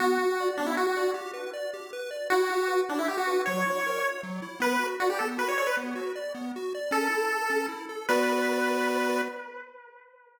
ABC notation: X:1
M:3/4
L:1/16
Q:1/4=156
K:Bm
V:1 name="Lead 1 (square)"
F6 D E F F3 | z12 | F6 D E G F3 | c8 z4 |
B3 z F G A z B c c B | z12 | A8 z4 | B12 |]
V:2 name="Lead 1 (square)"
B,2 F2 d2 B,2 F2 d2 | G2 B2 d2 G2 B2 d2 | E2 G2 B2 E2 G2 B2 | F,2 E2 ^A2 c2 F,2 E2 |
B,2 F2 d2 B,2 F2 d2 | B,2 F2 d2 B,2 F2 d2 | C2 E2 A2 C2 E2 A2 | [B,Fd]12 |]